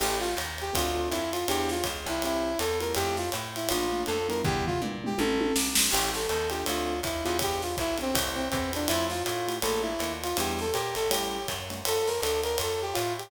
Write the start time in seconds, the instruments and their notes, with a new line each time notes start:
0.00 electric bass (finger) A1, acoustic grand piano C#4 E4 G4 A4, brass section G4, crash, ride
0.19 brass section F4, snare
0.37 electric bass (finger) D#2, hi-hat pedal, ride
0.58 brass section G4, ride
0.73 electric bass (finger) D2, acoustic grand piano C4 D4 F4 A4, brass section F4, kick, ride
0.95 acoustic grand piano C4 D4 F4 A4
1.10 electric bass (finger) F2, brass section E4, hi-hat pedal, ride
1.32 brass section F4, ride
1.48 electric bass (finger) E2, acoustic grand piano B3 D4 E4 G4, brass section G4, ride
1.69 brass section F4, snare
1.84 electric bass (finger) C#2, kick, hi-hat pedal, ride
2.05 electric bass (finger) C2, acoustic grand piano B3 D4 E4 G4, brass section E4, ride
2.22 acoustic grand piano A3 C4 E4 G4, brass section E4, ride
2.59 electric bass (finger) E2, brass section A4, hi-hat pedal, ride
2.80 acoustic grand piano A3 E4 F4 G4, brass section A#4, ride
2.95 electric bass (finger) F2, brass section G4, ride
3.17 brass section F4, snare
3.32 electric bass (finger) A2, hi-hat pedal, ride
3.56 brass section E4, ride
3.69 electric bass (finger) A#1, acoustic grand piano A3 A#3 D4 F4, brass section F4, ride
3.92 acoustic grand piano A3 A#3 D4 F4
4.06 electric bass (finger) F2, brass section A4, hi-hat pedal, ride
4.28 acoustic grand piano G3 B3 D4 E4, brass section A#4, ride
4.44 electric bass (finger) E2, brass section G4, kick, floor tom
4.66 brass section F4, floor tom
4.80 electric bass (finger) A#2, acoustic grand piano G3 B3 D4 E4, mid tom
5.03 acoustic grand piano G3 B3 D4 E4, brass section G4, mid tom
5.18 electric bass (finger) A1, acoustic grand piano G3 A3 C#4 E4, brass section A4, high tom
5.40 high tom
5.56 electric bass (finger) B1, snare
5.75 electric bass (finger) A#1, snare
5.91 electric bass (finger) A1, acoustic grand piano C#4 E4 G4 A4, brass section G4, crash, ride
6.14 brass section A4, snare
6.28 electric bass (finger) D#2, brass section A4, hi-hat pedal, ride
6.49 acoustic grand piano C4 D4 F4 A4, brass section G4, ride
6.66 electric bass (finger) D2, brass section F4, ride
7.03 electric bass (finger) D#2, brass section E4, kick, hi-hat pedal, ride
7.24 electric bass (finger) E2, acoustic grand piano B3 D4 E4 G4, brass section F4, ride
7.39 brass section G4, kick, ride
7.62 brass section F4, snare
7.77 electric bass (finger) B1, brass section E4, kick, hi-hat pedal, ride
7.98 acoustic grand piano B3 D4 E4 G4, brass section C4, ride
8.14 electric bass (finger) C2, acoustic grand piano A3 C4 E4 G4, kick, ride
8.35 brass section C4
8.50 electric bass (finger) E2, brass section C4, kick, hi-hat pedal, ride
8.72 acoustic grand piano A3 E4 F4 G4, brass section D4, ride
8.88 electric bass (finger) F2, brass section E4, ride
9.10 brass section F4, snare
9.23 electric bass (finger) A2, brass section F4, hi-hat pedal, ride
9.48 acoustic grand piano A3 E4 F4 G4, ride
9.62 electric bass (finger) A#1, acoustic grand piano A3 A#3 D4 F4, brass section A4, ride
9.82 brass section E4
9.99 electric bass (finger) D#2, acoustic grand piano A3 A#3 D4 F4, hi-hat pedal, ride
10.23 brass section F4, ride
10.37 electric bass (finger) E2, acoustic grand piano G3 B3 D4 E4, brass section G4, ride
10.59 brass section A4, snare
10.73 electric bass (finger) A#2, brass section G4, hi-hat pedal, ride
10.95 electric bass (finger) A1, brass section A4, ride
11.10 acoustic grand piano G3 A3 C#4 E4, brass section G4, ride
11.48 electric bass (finger) F#2, kick, hi-hat pedal, ride
11.70 acoustic grand piano G3 A3 C#4 E4, ride
11.85 electric bass (finger) F2, brass section A4, ride
12.07 brass section A#4, snare
12.20 electric bass (finger) D2, brass section A4, hi-hat pedal, ride
12.43 brass section A#4, ride
12.58 electric bass (finger) F2, ride
12.62 brass section A4
12.82 brass section G4
12.93 electric bass (finger) A2, brass section F4, hi-hat pedal, ride
13.18 brass section G4, ride